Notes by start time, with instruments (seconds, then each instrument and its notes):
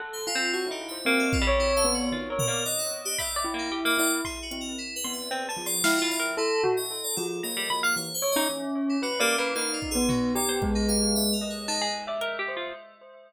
0.00 tubular bells A4, orchestral harp F#5
0.13 electric piano 2 C5
0.27 electric piano 2 F4, tubular bells F4
0.35 orchestral harp C4
0.53 tubular bells F#4, electric piano 2 C#5
0.67 orchestral harp D#4, tubular bells E4
0.71 electric piano 2 G4
0.88 tubular bells C5, electric piano 2 E5
1.05 orchestral harp A#3, tubular bells C4, electric piano 2 E5
1.19 electric piano 2 A4
1.33 electric piano 2 F4, kick
1.41 orchestral harp G3
1.47 tubular bells C#5
1.60 electric piano 2 E4
1.77 orchestral harp A4, electric piano 2 F5
1.84 tubular bells B3
1.94 electric piano 2 F#4
2.12 tubular bells D#3, orchestral harp F4
2.30 orchestral harp A#4, tubular bells C#5
2.39 electric piano 2 A#4, floor tom
2.47 orchestral harp A#3, tubular bells D5
2.65 electric piano 2 D5, tubular bells D#5, closed hi-hat
2.79 electric piano 2 F#5
3.05 electric piano 2 G4
3.18 electric piano 2 D5, tubular bells E5, orchestral harp B5, kick
3.36 orchestral harp D5
3.44 tubular bells E4
3.54 orchestral harp A#3
3.59 electric piano 2 D#4
3.72 orchestral harp G4
3.85 orchestral harp A#3, electric piano 2 D#5
3.98 tubular bells E4, electric piano 2 D5, cowbell
4.25 electric piano 2 G#4, orchestral harp C6, kick
4.42 electric piano 2 F#4
4.51 tubular bells C4, closed hi-hat
4.61 electric piano 2 A#4
4.78 electric piano 2 E4
4.96 electric piano 2 B4
5.04 tubular bells B3, orchestral harp C6
5.13 electric piano 2 E5
5.31 orchestral harp C4, electric piano 2 G#4, closed hi-hat
5.49 electric piano 2 G#4, orchestral harp A5
5.57 tubular bells F3
5.66 electric piano 2 D5, orchestral harp C6
5.84 tubular bells E4, electric piano 2 D#5, orchestral harp F5, snare
5.98 electric piano 2 F4
6.02 orchestral harp F4
6.11 electric piano 2 D5
6.20 orchestral harp A#4
6.37 electric piano 2 E4, tubular bells A4
6.63 tubular bells F#4, floor tom
6.77 electric piano 2 D#5
7.04 electric piano 2 D5
7.17 tubular bells F3, electric piano 2 A4
7.43 tubular bells A#3, electric piano 2 D#5, orchestral harp A#5
7.57 orchestral harp G3
7.70 orchestral harp B5
7.83 orchestral harp F5, electric piano 2 F#5
7.96 tubular bells E3, electric piano 2 C#5
8.14 electric piano 2 C5
8.22 tubular bells C#5
8.32 electric piano 2 D#5
8.36 tubular bells C#4, orchestral harp D#4
8.89 electric piano 2 E4
9.02 electric piano 2 F#4, tubular bells B4, orchestral harp F#5
9.20 orchestral harp A#3, electric piano 2 G4, tubular bells D5
9.38 orchestral harp A#3, electric piano 2 E4, tubular bells B4
9.55 orchestral harp A#3, tubular bells D#4, electric piano 2 F5, clap
9.73 electric piano 2 F4
9.82 kick
9.91 electric piano 2 G#4
9.95 tubular bells B3
10.09 electric piano 2 D#4, orchestral harp F#4, floor tom
10.35 tubular bells G4, electric piano 2 D5
10.49 orchestral harp C5
10.62 tubular bells G#3, kick
10.75 electric piano 2 D#4
10.88 electric piano 2 F5, closed hi-hat
11.15 electric piano 2 E5, high tom
11.33 electric piano 2 A#4
11.41 tubular bells D#5
11.50 electric piano 2 C#5
11.68 electric piano 2 D#4, orchestral harp A5, clap
11.82 orchestral harp G#4
12.07 orchestral harp D5, tubular bells E5
12.21 orchestral harp A#4, closed hi-hat
12.39 orchestral harp G4
12.48 tubular bells C5
12.57 orchestral harp F4